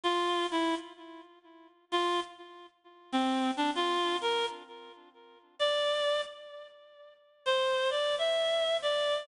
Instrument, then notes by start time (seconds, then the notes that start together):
clarinet
0.03 F4
0.51 E4
1.92 F4
3.12 C4
3.57 D4
3.75 F4
4.21 A#4
5.59 D5
7.46 C5
7.90 D5
8.18 E5
8.82 D5